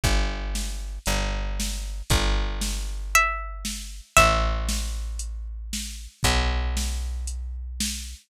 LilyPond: <<
  \new Staff \with { instrumentName = "Pizzicato Strings" } { \time 4/4 \key c \major \tempo 4 = 116 r1 | r2 e''2 | e''1 | r1 | }
  \new Staff \with { instrumentName = "Electric Bass (finger)" } { \clef bass \time 4/4 \key c \major g,,2 g,,2 | g,,1 | a,,1 | b,,1 | }
  \new DrumStaff \with { instrumentName = "Drums" } \drummode { \time 4/4 <hh bd>4 sn4 hh4 sn4 | <hh bd>4 sn4 hh4 sn4 | <hh bd>4 sn4 hh4 sn4 | <hh bd>4 sn4 hh4 sn4 | }
>>